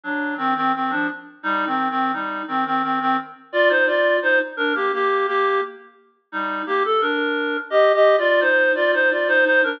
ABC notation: X:1
M:3/4
L:1/16
Q:1/4=86
K:Cm
V:1 name="Clarinet"
[^F,D]2 [E,C] [E,C] [E,C] [=F,D] z2 | (3[G,E]2 [E,C]2 [E,C]2 [G,E]2 [E,C] [E,C] [E,C] [E,C] z2 | [Fd] [Ec] [Fd]2 [Ec] z [DB] [B,G] [B,G]2 [B,G]2 | z4 [G,E]2 [B,G] =A [DB]4 |
(3[Ge]2 [Ge]2 [Fd]2 [Ec]2 [Fd] [Ec] [Fd] [Ec] [Ec] [DB] |]